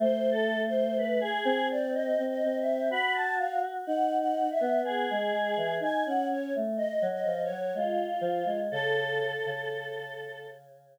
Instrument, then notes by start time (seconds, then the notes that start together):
choir aahs
0.00 A3 C5
0.31 A4
0.66 C5
0.97 B4
1.21 G#4
1.45 C4
1.70 D5
1.94 D#5
2.18 C4
2.28 D#5
2.43 C4
2.58 E5
2.90 F#4 B5
3.14 A5
3.38 F5
3.86 D#4 F#5
4.19 F#5
4.50 E5
4.60 B3
4.82 B3 G#4
5.10 G#3
5.32 G#3
5.56 E3
5.80 D#4 G#5
6.05 C#4 F#5
6.29 C#4 C#5
6.55 A3
6.76 D#5
7.02 F#3
7.11 D#5
7.24 F3
7.43 C#5
7.49 F#3
7.74 G#3 F4
8.21 F3
8.45 G#3
8.71 C#3 A4
9.46 C#3